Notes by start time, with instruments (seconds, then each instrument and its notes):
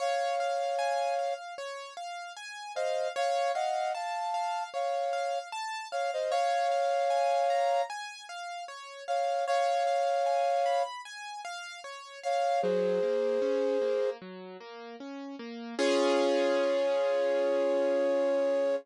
0.00 acoustic grand piano C#5, flute C#5 F5
0.40 acoustic grand piano F5
0.79 acoustic grand piano G#5
1.19 acoustic grand piano F5
1.58 acoustic grand piano C#5
1.97 acoustic grand piano F5
2.37 acoustic grand piano G#5
2.75 flute C5 D#5, acoustic grand piano F5
3.16 acoustic grand piano C#5, flute C#5 F5
3.54 flute D#5 F#5, acoustic grand piano F5
3.94 flute F5 A5, acoustic grand piano A5
4.34 acoustic grand piano F5
4.74 acoustic grand piano C#5, flute C#5 F5
5.13 acoustic grand piano F5
5.52 acoustic grand piano A5
5.92 flute C#5 F5, acoustic grand piano F5
6.13 flute C5 D#5
6.31 flute C#5 F5, acoustic grand piano C#5
6.72 acoustic grand piano F5
7.10 acoustic grand piano G#5
7.50 acoustic grand piano A#5
7.90 acoustic grand piano G#5
8.29 acoustic grand piano F5
8.68 acoustic grand piano C#5
9.08 flute C#5 F5, acoustic grand piano F5
9.47 flute C#5 F5, acoustic grand piano C#5
9.87 acoustic grand piano F5
10.26 acoustic grand piano G#5
10.66 acoustic grand piano B5
11.05 acoustic grand piano G#5
11.45 acoustic grand piano F5
11.84 acoustic grand piano C#5
12.24 flute C#5 F5, acoustic grand piano F5
12.62 acoustic grand piano F#3, flute G#4 C5
13.03 acoustic grand piano A#3
13.42 acoustic grand piano C#4
13.82 acoustic grand piano A#3
14.22 acoustic grand piano F#3
14.60 acoustic grand piano A#3
15.00 acoustic grand piano C#4
15.39 acoustic grand piano A#3
15.78 acoustic grand piano C#4 F4 G#4, flute C#5